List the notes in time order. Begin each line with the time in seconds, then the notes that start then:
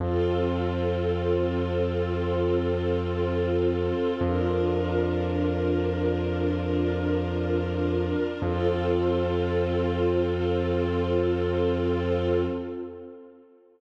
0.00 F2 C4 F4 A4
4.21 F2 D4 F4 A#4
8.42 F2 C4 F4 A4